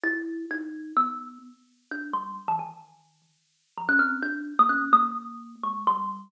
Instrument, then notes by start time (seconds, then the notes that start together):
kalimba
0.03 E4
0.51 D#4
0.97 B3
1.91 D4
2.13 G3
2.48 E3
2.59 D#3
3.78 F3
3.89 C#4
3.99 C4
4.22 D4
4.59 A#3
4.69 C#4
4.93 A#3
5.63 G#3
5.87 G3